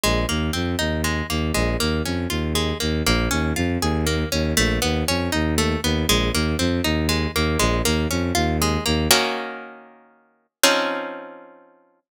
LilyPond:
<<
  \new Staff \with { instrumentName = "Orchestral Harp" } { \time 3/4 \key bes \dorian \tempo 4 = 119 aes8 bes8 c'8 ees'8 aes8 bes8 | aes8 bes8 des'8 f'8 aes8 bes8 | bes8 des'8 f'8 aes'8 bes8 des'8 | a8 b8 cis'8 dis'8 a8 b8 |
aes8 bes8 c'8 ees'8 aes8 bes8 | aes8 bes8 des'8 f'8 aes8 bes8 | \key ees \dorian <ees bes des' ges'>2. | <f c' des' ees'>2. | }
  \new Staff \with { instrumentName = "Violin" } { \clef bass \time 3/4 \key bes \dorian bes,,8 ees,8 f,8 ees,4 ees,8 | bes,,8 ees,8 f,8 ees,4 ees,8 | bes,,8 ees,8 f,8 ees,4 ees,8 | bes,,8 dis,8 f,8 dis,4 dis,8 |
bes,,8 ees,8 f,8 ees,4 ees,8 | bes,,8 ees,8 f,8 ees,4 ees,8 | \key ees \dorian r2. | r2. | }
>>